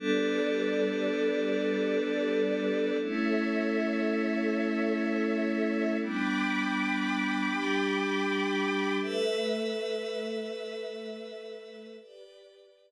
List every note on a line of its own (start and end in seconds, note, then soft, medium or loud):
0.00 2.97 G3 medium
0.00 2.97 B3 medium
0.00 2.97 D4 medium
0.00 2.97 A4 medium
0.00 2.97 B4 medium
0.00 2.97 D5 medium
3.00 5.97 A3 medium
3.00 5.97 C#4 medium
3.00 5.97 E4 medium
3.00 5.97 A4 medium
3.00 5.97 C#5 medium
3.00 5.97 E5 medium
6.00 7.49 G3 medium
6.00 7.49 B3 medium
6.00 7.49 D4 medium
6.00 8.97 G5 medium
6.00 8.97 B5 medium
6.00 8.97 D6 medium
7.50 8.99 G3 medium
7.50 8.99 D4 medium
7.50 8.99 G4 medium
8.99 11.96 A3 medium
8.99 11.97 A4 medium
8.99 11.96 B4 medium
8.99 11.97 B4 medium
8.99 11.96 E5 medium
8.99 11.97 E5 medium
12.00 12.91 G4 medium
12.00 12.91 B4 medium
12.00 12.91 D5 medium